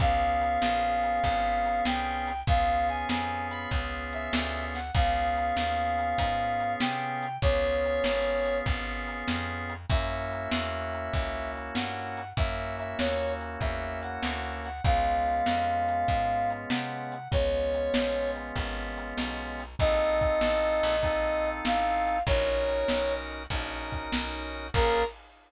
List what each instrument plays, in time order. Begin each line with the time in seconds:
0.00 electric bass (finger) C#2, drawbar organ B3 C#4 F4 G#4, brass section F5, kick, closed hi-hat
0.42 closed hi-hat
0.62 electric bass (finger) A#1, snare
1.04 closed hi-hat
1.24 electric bass (finger) G#1, kick, closed hi-hat
1.66 closed hi-hat
1.85 electric bass (finger) C2, brass section G5, snare
2.27 closed hi-hat
2.47 electric bass (finger) C#2, drawbar organ B3 C#4 F4 G#4, brass section F5, kick, closed hi-hat
2.89 brass section G#5, closed hi-hat
3.09 electric bass (finger) F2, brass section G#5, snare
3.51 brass section B5, closed hi-hat
3.71 electric bass (finger) C#2, kick, closed hi-hat
4.13 brass section E5, closed hi-hat
4.33 electric bass (finger) D2, snare
4.75 brass section F#5, snare
4.94 electric bass (finger) C#2, drawbar organ B3 C#4 F4 G#4, brass section F5, kick, closed hi-hat
5.37 closed hi-hat
5.57 electric bass (finger) D#2, snare
5.99 closed hi-hat
6.18 electric bass (finger) G#2, kick, closed hi-hat
6.60 closed hi-hat
6.80 electric bass (finger) C3, brass section G5, snare
7.22 closed hi-hat
7.42 electric bass (finger) C#2, drawbar organ B3 C#4 F4 G#4, brass section C#5, kick, closed hi-hat
7.84 closed hi-hat
8.04 electric bass (finger) G#1, snare
8.46 closed hi-hat
8.66 electric bass (finger) G#1, kick, closed hi-hat
9.08 closed hi-hat
9.28 electric bass (finger) F2, snare
9.70 closed hi-hat
9.90 electric bass (finger) F#2, drawbar organ A#3 C#4 E4 F#4, brass section E5, kick, closed hi-hat
10.32 closed hi-hat
10.51 electric bass (finger) E2, snare
10.93 closed hi-hat
11.13 electric bass (finger) C#2, kick, closed hi-hat
11.56 closed hi-hat
11.75 electric bass (finger) G2, brass section F#5, snare
12.17 closed hi-hat
12.37 electric bass (finger) F#2, drawbar organ A#3 C#4 E4 F#4, brass section E5, kick, closed hi-hat
12.79 brass section E5, closed hi-hat
12.99 electric bass (finger) D#2, brass section C#5, snare
13.41 closed hi-hat
13.61 electric bass (finger) E2, brass section E5, kick, closed hi-hat
14.03 brass section F#5, closed hi-hat
14.23 electric bass (finger) D2, snare
14.65 brass section F#5, closed hi-hat
14.84 electric bass (finger) C#2, drawbar organ G#3 B3 C#4 F4, brass section F5, kick, closed hi-hat
15.26 closed hi-hat
15.46 electric bass (finger) F2, snare
15.89 closed hi-hat
16.08 electric bass (finger) G#2, kick, closed hi-hat
16.50 closed hi-hat
16.70 electric bass (finger) C3, brass section F#5, snare
17.12 closed hi-hat
17.31 electric bass (finger) C#2, drawbar organ G#3 B3 C#4 F4, brass section C#5, kick, closed hi-hat
17.74 closed hi-hat
17.94 electric bass (finger) A#1, snare
18.36 closed hi-hat
18.56 electric bass (finger) G#1, kick, closed hi-hat
18.98 closed hi-hat
19.18 electric bass (finger) B1, snare
19.60 closed hi-hat
19.79 electric bass (finger) A#1, drawbar organ C4 D#4 F4 A4, brass section D#5, kick, closed hi-hat
20.21 kick, closed hi-hat
20.41 electric bass (finger) A1, snare
20.83 electric bass (finger) A#1, closed hi-hat
21.02 drawbar organ C4 D#4 F4 A4, kick, closed hi-hat
21.45 closed hi-hat
21.65 electric bass (finger) A1, brass section F5, snare
22.07 closed hi-hat
22.27 electric bass (finger) A#1, drawbar organ C#4 D#4 F#4 A#4, brass section C#5, kick, closed hi-hat
22.69 closed hi-hat
22.88 electric bass (finger) B1, snare
23.31 closed hi-hat
23.50 electric bass (finger) A#1, drawbar organ C#4 D#4 F#4 A#4, kick, closed hi-hat
23.92 kick, closed hi-hat
24.12 electric bass (finger) B1, snare
24.54 closed hi-hat
24.74 electric bass (finger) A#1, drawbar organ A#3 C#4 F4 G#4, brass section A#4, kick, crash